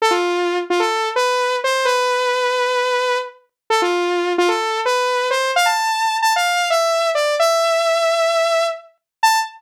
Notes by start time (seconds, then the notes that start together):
0.02 A4
0.11 F4
0.70 F4
0.80 A4
1.16 B4
1.64 C5
1.85 B4
3.70 A4
3.82 F4
4.38 F4
4.48 A4
4.85 B4
5.30 C5
5.56 F5
5.66 A5
6.22 A5
6.36 F5
6.70 E5
7.15 D5
7.40 E5
9.23 A5